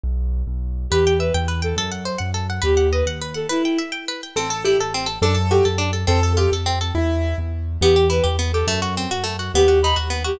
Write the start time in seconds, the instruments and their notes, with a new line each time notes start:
0.03 acoustic grand piano B1
0.47 acoustic grand piano B1
0.90 acoustic grand piano E2, violin G4, orchestral harp B4
1.07 orchestral harp G5
1.19 violin B4, orchestral harp E5
1.34 acoustic grand piano E2, orchestral harp G5
1.48 orchestral harp B4
1.62 violin A4, orchestral harp G5
1.76 acoustic grand piano F#2, orchestral harp A4
1.91 orchestral harp F#5
2.05 orchestral harp C5
2.18 acoustic grand piano F#2, orchestral harp F#5
2.34 orchestral harp A4
2.50 orchestral harp F#5
2.62 acoustic grand piano D#2, violin G4, orchestral harp B4
2.77 orchestral harp F#5
2.92 violin B4, orchestral harp D#5
3.06 acoustic grand piano D#2, orchestral harp F#5
3.22 orchestral harp B4
3.34 violin A4, orchestral harp F#5
3.49 violin E4, orchestral harp B4
3.65 orchestral harp G5
3.78 orchestral harp E5
3.92 orchestral harp G5
4.08 orchestral harp B4
4.23 orchestral harp G5
4.36 acoustic grand piano A1 A4, orchestral harp C4
4.50 orchestral harp A4
4.65 orchestral harp E4, acoustic grand piano G4
4.78 acoustic grand piano A1, orchestral harp A4
4.94 orchestral harp C4
5.06 orchestral harp A4
5.22 acoustic grand piano F#2 A4, orchestral harp D4
5.35 orchestral harp A4
5.51 orchestral harp F#4, acoustic grand piano G4
5.65 acoustic grand piano F#2, orchestral harp A4
5.78 orchestral harp D4
5.93 orchestral harp A4
6.07 acoustic grand piano F2 A4, orchestral harp C4
6.23 orchestral harp A4
6.37 orchestral harp F4, acoustic grand piano G4
6.52 acoustic grand piano F2, orchestral harp A4
6.66 orchestral harp C4
6.81 orchestral harp A4
6.95 acoustic grand piano E2 E4
7.38 acoustic grand piano E2
7.81 acoustic grand piano E2, orchestral harp B3, violin G4
7.96 orchestral harp G4
8.10 orchestral harp E4, violin B4
8.24 acoustic grand piano E2, orchestral harp G4
8.39 orchestral harp B3
8.53 orchestral harp G4, violin A4
8.67 acoustic grand piano F#2, orchestral harp A3
8.82 orchestral harp F#4
8.97 orchestral harp C4
9.11 acoustic grand piano F#2, orchestral harp F#4
9.24 orchestral harp A3
9.39 orchestral harp F#4
9.54 acoustic grand piano D#2, orchestral harp B3, violin G4
9.68 orchestral harp F#4
9.83 orchestral harp D#4, violin B5
9.96 acoustic grand piano D#2, orchestral harp F#4
10.10 orchestral harp B3
10.24 orchestral harp F#4, violin G4